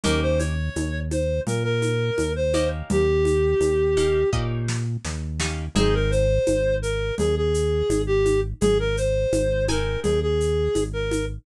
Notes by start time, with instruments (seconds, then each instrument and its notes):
0.04 synth bass 1 D#2, acoustic guitar (steel) A#3 C#4 D#4 G4, clarinet A#4, low conga, shaker
0.22 clarinet C5
0.39 clarinet C#5, high conga, shaker
0.76 synth bass 1 D#2, high conga, shaker
1.11 clarinet C5, high conga, shaker
1.47 synth bass 1 A#2, clarinet A#4, low conga, shaker
1.64 clarinet A#4
1.82 high conga, shaker
2.18 synth bass 1 D#2, high conga, shaker
2.36 clarinet C5
2.54 acoustic guitar (steel) A#3 C#4 D#4 G4, high conga, shaker
2.90 synth bass 1 D#2, clarinet G4, low conga, shaker
3.25 high conga, shaker
3.60 synth bass 1 D#2, high conga, shaker
3.97 acoustic guitar (steel) A#3 C#4 D#4 G4, high conga, shaker
4.33 synth bass 1 A#2, acoustic guitar (steel) A#3 C#4 D#4 G4, kick
4.68 snare
5.05 synth bass 1 D#2, snare
5.40 acoustic guitar (steel) A#3 C#4 D#4 G4, snare
5.75 synth bass 1 G#1, acoustic guitar (steel) C4 D#4 G#4, clarinet G#4, low conga, shaker
5.94 clarinet A#4
6.11 clarinet C5, shaker
6.47 synth bass 1 G#1, high conga, shaker
6.82 clarinet A#4, shaker
7.18 synth bass 1 D#2, clarinet G#4, low conga, shaker
7.37 clarinet G#4
7.54 shaker
7.89 synth bass 1 G#1, high conga, shaker
8.07 clarinet G4
8.25 high conga, shaker
8.61 synth bass 1 G#1, clarinet G#4, low conga, shaker
8.79 clarinet A#4
8.97 clarinet C5, shaker
9.33 synth bass 1 G#1, high conga, shaker
9.68 acoustic guitar (steel) C4 D#4 G#4, clarinet A#4, high conga, shaker
10.03 synth bass 1 D#2, clarinet G#4, low conga, shaker
10.22 clarinet G#4
10.40 shaker
10.75 synth bass 1 G#1, high conga, shaker
10.93 clarinet A#4
11.11 high conga, shaker